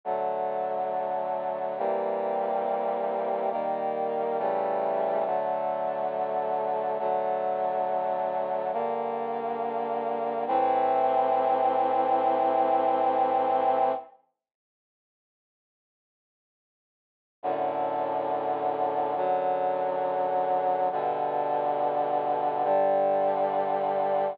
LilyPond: \new Staff { \time 4/4 \key g \minor \tempo 4 = 69 <d fis a>2 <c e g bes>2 | <ees g bes>4 <cis e g a>4 <d fis a>2 | <d fis a>2 <g, d bes>2 | \key a \minor <a, e c'>1 |
r1 | <fis, a, d>2 <fis, d fis>2 | <g, b, d>2 <g, d g>2 | }